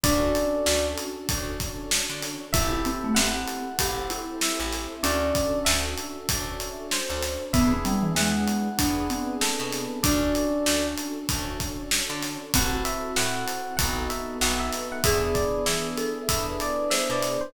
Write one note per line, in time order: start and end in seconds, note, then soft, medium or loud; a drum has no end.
0.04 0.32 D2 medium
0.04 1.18 C#4 loud
0.04 1.28 C#4 medium
0.04 1.18 D4 loud
0.04 1.28 D4 medium
0.04 1.51 D4 loud
0.04 1.18 F#4 loud
0.04 1.28 F#4 medium
0.04 1.18 A4 loud
0.04 1.28 A4 medium
0.04 0.86 D5 loud
0.04 kick loud
0.04 closed hi-hat loud
0.35 closed hi-hat medium
0.66 0.95 D2 medium
0.66 snare loud
0.98 closed hi-hat medium
1.29 1.57 D2 medium
1.29 2.44 C#4 medium
1.29 2.54 C#4 medium
1.29 2.44 D4 medium
1.29 2.54 D4 medium
1.29 2.44 F#4 medium
1.29 2.44 A4 medium
1.29 2.54 A4 medium
1.29 2.54 C#5 medium
1.29 kick loud
1.29 closed hi-hat loud
1.60 kick medium
1.60 snare soft
1.60 closed hi-hat medium
1.91 snare loud
2.10 2.37 D3 medium
2.23 snare medium
2.23 closed hi-hat medium
2.53 2.82 A1 medium
2.53 3.68 C4 loud
2.53 3.78 C4 medium
2.53 3.68 E4 loud
2.53 3.78 E4 medium
2.53 2.71 E4 loud
2.53 3.68 G4 loud
2.53 3.78 G4 medium
2.53 3.68 A4 loud
2.53 3.78 A4 medium
2.53 3.12 E5 loud
2.53 kick loud
2.53 closed hi-hat loud
2.71 2.84 E4 loud
2.85 3.03 C4 loud
2.85 closed hi-hat medium
3.04 3.17 A3 loud
3.15 3.45 A1 medium
3.15 3.60 C4 loud
3.15 4.20 F#5 medium
3.15 snare loud
3.48 closed hi-hat medium
3.79 4.07 A1 medium
3.79 4.93 C4 loud
3.79 5.03 C4 medium
3.79 4.93 E4 medium
3.79 5.03 E4 medium
3.79 4.93 G4 medium
3.79 4.07 G4 medium
3.79 4.93 A4 medium
3.79 5.03 A4 medium
3.79 5.03 C5 medium
3.79 kick medium
3.79 closed hi-hat loud
4.10 5.03 E4 loud
4.10 closed hi-hat medium
4.41 4.95 E5 medium
4.41 snare loud
4.60 4.87 A1 medium
4.73 snare medium
4.73 closed hi-hat medium
5.03 5.32 D2 medium
5.03 5.61 C#4 loud
5.03 6.18 C#4 medium
5.03 6.28 C#4 medium
5.03 6.18 D4 loud
5.03 6.28 D4 medium
5.03 6.18 F#4 loud
5.03 6.28 F#4 medium
5.03 6.18 A4 loud
5.03 6.28 A4 medium
5.03 5.58 D5 loud
5.03 closed hi-hat loud
5.35 kick medium
5.35 closed hi-hat medium
5.65 5.95 D2 medium
5.65 6.69 E5 medium
5.65 snare loud
5.98 closed hi-hat medium
6.29 6.57 D2 medium
6.29 7.43 C#4 medium
6.29 7.53 C#4 medium
6.29 7.43 D4 loud
6.29 7.53 D4 medium
6.29 7.43 F#4 medium
6.29 7.43 A4 medium
6.29 7.53 A4 medium
6.29 7.53 C#5 medium
6.29 kick loud
6.29 closed hi-hat loud
6.60 closed hi-hat medium
6.91 7.45 C5 medium
6.91 snare loud
7.10 7.37 D2 medium
7.23 snare medium
7.23 closed hi-hat medium
7.53 7.82 E2 medium
7.53 8.77 B3 medium
7.53 7.71 B3 loud
7.53 8.68 B3 loud
7.53 8.77 D4 medium
7.53 8.68 D4 loud
7.53 8.77 E4 medium
7.53 8.68 E4 loud
7.53 8.77 G#4 medium
7.53 8.68 G#4 loud
7.53 8.13 E5 medium
7.53 kick loud
7.53 closed hi-hat loud
7.72 7.85 C4 loud
7.85 8.03 G3 loud
7.85 closed hi-hat medium
8.03 8.15 E3 medium
8.15 8.45 E2 medium
8.15 8.63 G#3 loud
8.15 9.34 F#5 medium
8.15 snare loud
8.48 closed hi-hat medium
8.78 9.07 E2 medium
8.78 9.93 B3 medium
8.78 10.03 B3 medium
8.78 9.08 D4 loud
8.78 9.93 D4 medium
8.78 10.03 D4 medium
8.78 9.93 E4 medium
8.78 9.93 G#4 medium
8.78 10.03 G#4 medium
8.78 10.03 B4 medium
8.78 kick loud
8.78 closed hi-hat loud
9.10 9.93 C4 loud
9.10 closed hi-hat medium
9.41 10.02 A4 medium
9.41 snare loud
9.60 9.87 B2 medium
9.73 snare medium
9.73 closed hi-hat medium
10.03 10.32 D2 medium
10.03 11.27 C#4 medium
10.03 11.18 C#4 loud
10.03 11.27 D4 medium
10.03 11.18 D4 loud
10.03 11.51 D4 loud
10.03 11.27 F#4 medium
10.03 11.18 F#4 loud
10.03 11.27 A4 medium
10.03 11.18 A4 loud
10.03 10.86 D5 loud
10.03 kick loud
10.03 closed hi-hat loud
10.35 closed hi-hat medium
10.66 10.95 D2 medium
10.66 snare loud
10.98 closed hi-hat medium
11.28 11.57 D2 medium
11.28 12.52 C#4 medium
11.28 12.43 C#4 medium
11.28 12.52 D4 medium
11.28 12.43 D4 medium
11.28 12.43 F#4 medium
11.28 12.52 A4 medium
11.28 12.43 A4 medium
11.28 12.52 C#5 medium
11.28 kick loud
11.28 closed hi-hat loud
11.60 kick medium
11.60 snare soft
11.60 closed hi-hat medium
11.91 snare loud
12.10 12.37 D3 medium
12.23 snare medium
12.23 closed hi-hat medium
12.54 12.82 A1 medium
12.54 13.11 C4 loud
12.54 13.16 C4 medium
12.54 14.84 C4 loud
12.54 13.11 E4 loud
12.54 13.16 E4 medium
12.54 13.11 F#4 loud
12.54 13.16 F#4 medium
12.54 13.11 A4 loud
12.54 13.16 A4 medium
12.54 12.73 F#5 medium
12.54 kick loud
12.54 closed hi-hat loud
12.85 13.15 E5 medium
12.85 closed hi-hat medium
13.16 13.45 A2 medium
13.16 13.73 C4 loud
13.16 13.79 C4 medium
13.16 13.73 E4 medium
13.16 13.79 E4 medium
13.16 13.73 F#4 medium
13.16 13.73 A4 medium
13.16 13.79 A4 medium
13.16 13.79 C5 medium
13.16 13.76 F#5 medium
13.16 snare loud
13.48 closed hi-hat medium
13.77 14.07 B1 medium
13.77 14.36 B3 loud
13.77 14.41 B3 medium
13.77 14.36 D#4 loud
13.77 14.41 D#4 medium
13.77 14.36 F#4 loud
13.77 14.41 F#4 medium
13.77 14.36 A4 loud
13.77 14.41 A4 medium
13.77 13.94 F#5 medium
13.77 kick loud
13.77 closed hi-hat loud
14.10 14.37 E5 medium
14.10 closed hi-hat medium
14.41 14.70 B1 medium
14.41 15.03 B3 medium
14.41 14.98 B3 medium
14.41 15.03 D#4 medium
14.41 14.98 D#4 medium
14.41 14.98 F#4 medium
14.41 15.03 A4 medium
14.41 14.98 A4 medium
14.41 15.03 B4 medium
14.41 14.59 F#5 medium
14.41 snare loud
14.60 14.88 E5 medium
14.73 snare medium
14.73 closed hi-hat medium
14.92 15.04 F#5 medium
15.04 15.32 E2 medium
15.04 16.18 B3 loud
15.04 16.28 B3 medium
15.04 16.18 D4 loud
15.04 16.28 D4 medium
15.04 16.18 E4 loud
15.04 16.28 E4 medium
15.04 16.18 G#4 loud
15.04 16.28 G#4 medium
15.04 15.88 G#4 loud
15.04 15.21 E5 loud
15.04 kick loud
15.04 closed hi-hat loud
15.35 15.64 D5 medium
15.35 kick medium
15.35 closed hi-hat medium
15.66 15.95 E3 medium
15.66 16.22 E5 medium
15.66 snare loud
15.98 16.83 A4 loud
15.98 closed hi-hat medium
16.28 16.57 E2 medium
16.28 17.52 B3 medium
16.28 17.43 B3 medium
16.28 17.52 D4 medium
16.28 17.43 D4 medium
16.28 17.43 E4 medium
16.28 17.52 G#4 medium
16.28 17.43 G#4 medium
16.28 17.52 B4 medium
16.28 16.46 E5 medium
16.28 kick medium
16.28 closed hi-hat loud
16.60 16.89 D5 medium
16.60 closed hi-hat medium
16.90 17.51 C5 loud
16.90 17.08 E5 medium
16.90 snare loud
17.10 17.37 B2 medium
17.10 17.41 D5 medium
17.23 snare medium
17.23 closed hi-hat medium
17.41 17.53 C5 medium